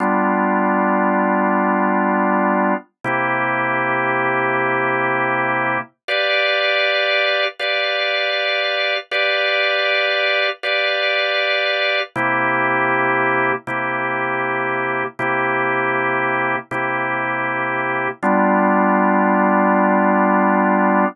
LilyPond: \new Staff { \time 4/4 \key g \major \tempo 4 = 79 <g b d' f'>1 | <c bes e' g'>1 | <g' b' d'' f''>2 <g' b' d'' f''>2 | <g' b' d'' f''>2 <g' b' d'' f''>2 |
<c bes e' g'>2 <c bes e' g'>2 | <c bes e' g'>2 <c bes e' g'>2 | <g b d' f'>1 | }